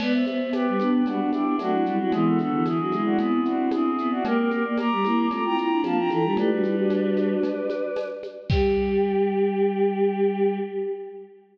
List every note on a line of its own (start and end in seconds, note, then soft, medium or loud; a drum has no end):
0.00 0.23 B3 loud
0.00 0.13 B4 loud
0.00 0.13 D5 loud
0.00 crash loud
0.00 cowbell medium
0.00 low conga medium
0.00 shaker medium
0.13 0.26 C5 loud
0.13 0.26 E5 loud
0.26 0.39 B3 loud
0.26 0.49 C5 medium
0.26 0.49 E5 loud
0.26 high conga medium
0.26 shaker medium
0.40 0.53 B3 loud
0.53 0.66 B3 loud
0.53 0.89 G4 medium
0.53 0.89 B4 loud
0.53 tambourine medium
0.53 cowbell medium
0.53 high conga medium
0.53 shaker medium
0.67 0.80 G3 medium
0.79 1.04 B3 medium
0.79 1.02 B3 loud
0.79 1.04 D4 medium
0.79 high conga medium
0.79 shaker medium
0.93 1.06 G4 medium
0.93 1.06 B4 loud
1.06 1.19 G3 medium
1.06 1.19 B3 medium
1.06 1.43 D4 loud
1.06 1.30 D4 medium
1.06 1.30 F#4 loud
1.06 cowbell medium
1.06 low conga medium
1.06 shaker medium
1.20 1.31 B3 medium
1.20 1.31 D4 medium
1.31 1.55 B3 medium
1.31 1.55 D4 medium
1.31 1.55 E4 loud
1.31 1.55 G4 loud
1.31 high conga medium
1.31 shaker medium
1.45 1.58 D4 loud
1.59 1.83 F#3 loud
1.59 1.73 A3 medium
1.59 1.71 C4 medium
1.59 1.97 D4 loud
1.59 1.97 F#4 loud
1.59 tambourine medium
1.59 cowbell medium
1.59 high conga medium
1.59 shaker medium
1.71 1.84 C4 medium
1.71 1.84 E4 medium
1.86 1.99 G3 loud
1.86 1.99 E4 medium
1.86 1.99 G4 medium
1.86 shaker medium
1.99 2.12 F#3 loud
1.99 2.13 C4 medium
1.99 2.11 D4 medium
1.99 2.13 E4 medium
1.99 2.11 F#4 loud
2.12 2.39 E3 loud
2.12 2.38 G#3 medium
2.12 2.38 B3 medium
2.12 2.25 E4 loud
2.12 2.25 G#4 loud
2.12 cowbell medium
2.12 low conga medium
2.12 shaker medium
2.26 2.38 F#4 medium
2.26 2.38 A4 loud
2.38 2.52 D3 loud
2.38 2.64 B3 medium
2.38 2.64 D4 medium
2.38 2.64 F#4 medium
2.38 2.64 A4 loud
2.38 high conga medium
2.38 shaker medium
2.51 2.64 E3 loud
2.65 2.78 E3 loud
2.65 3.02 E4 medium
2.65 3.02 G#4 loud
2.65 tambourine medium
2.65 cowbell medium
2.65 high conga medium
2.65 shaker medium
2.79 2.92 F#3 medium
2.92 3.17 G#3 loud
2.92 3.89 C4 medium
2.92 3.89 E4 medium
2.92 high conga medium
2.92 shaker medium
3.05 3.18 D4 loud
3.05 3.18 F#4 loud
3.19 3.40 B3 loud
3.19 3.44 E4 medium
3.19 3.44 G#4 loud
3.19 cowbell medium
3.19 low conga medium
3.19 shaker medium
3.45 3.68 C4 loud
3.45 3.69 D4 medium
3.45 3.69 F#4 loud
3.45 shaker medium
3.71 3.84 D4 loud
3.71 4.09 E4 medium
3.71 4.09 G#4 loud
3.71 tambourine medium
3.71 cowbell medium
3.71 high conga medium
3.71 shaker medium
3.85 3.97 C4 loud
3.98 4.12 B3 loud
3.98 shaker medium
4.11 4.23 C4 loud
4.11 4.24 D4 loud
4.11 4.24 F#4 loud
4.25 4.49 A#3 loud
4.25 4.37 G4 loud
4.25 4.37 A#4 loud
4.25 cowbell loud
4.25 low conga medium
4.25 shaker medium
4.38 4.51 G4 loud
4.38 4.51 A#4 loud
4.50 4.63 A#3 loud
4.50 4.64 G4 loud
4.50 4.64 A#4 loud
4.50 high conga medium
4.50 shaker medium
4.64 4.77 A#3 medium
4.64 4.77 A#4 medium
4.64 4.77 D5 loud
4.78 4.90 A#3 loud
4.78 5.26 A#5 loud
4.78 5.26 D6 loud
4.78 tambourine medium
4.78 cowbell medium
4.78 high conga medium
4.78 shaker medium
4.91 5.04 G3 loud
5.03 5.28 A#3 loud
5.03 5.26 C4 medium
5.03 5.26 E4 medium
5.03 high conga medium
5.03 shaker medium
5.31 5.43 A3 medium
5.31 5.43 C4 medium
5.31 5.69 F4 medium
5.31 5.43 A#5 medium
5.31 5.43 D6 loud
5.31 cowbell medium
5.31 low conga medium
5.31 shaker medium
5.44 5.57 C4 medium
5.44 5.57 E4 medium
5.44 5.57 G5 loud
5.44 5.57 A#5 loud
5.58 5.79 C4 medium
5.58 5.79 E4 medium
5.58 5.81 G5 medium
5.58 5.81 A#5 loud
5.58 shaker medium
5.71 5.84 D4 loud
5.83 6.08 F3 loud
5.83 5.98 A#3 medium
5.83 5.97 D4 medium
5.83 5.97 F5 loud
5.83 5.97 A5 loud
5.83 tambourine medium
5.83 cowbell medium
5.83 high conga medium
5.83 shaker medium
5.97 6.10 D4 medium
5.97 6.10 F4 medium
5.97 6.10 G5 loud
5.97 6.10 A#5 loud
6.10 6.23 E3 loud
6.10 6.24 F4 medium
6.10 6.24 A4 medium
6.10 6.34 G5 medium
6.10 6.34 A#5 loud
6.10 high conga medium
6.10 shaker medium
6.24 6.36 G3 loud
6.24 6.37 D4 medium
6.24 6.37 F4 medium
6.37 6.50 A3 loud
6.37 6.50 E4 medium
6.37 6.50 G4 medium
6.37 8.07 B4 loud
6.37 8.07 D5 loud
6.37 cowbell medium
6.37 low conga loud
6.37 shaker medium
6.50 7.34 G3 loud
6.50 6.64 D4 medium
6.50 6.64 F#4 medium
6.63 6.75 E4 medium
6.63 6.75 G4 medium
6.63 high conga medium
6.63 shaker medium
6.75 7.51 D4 medium
6.75 7.51 F#4 medium
6.90 tambourine medium
6.90 cowbell medium
6.90 high conga medium
6.90 shaker medium
7.17 high conga medium
7.17 shaker medium
7.43 cowbell medium
7.43 low conga medium
7.43 shaker medium
7.70 high conga medium
7.70 shaker medium
7.96 tambourine medium
7.96 cowbell medium
7.96 high conga medium
7.96 shaker medium
8.23 high conga medium
8.23 shaker medium
8.49 10.57 G3 loud
8.49 10.57 G4 loud
8.49 10.55 G5 loud
8.49 kick loud
8.49 crash loud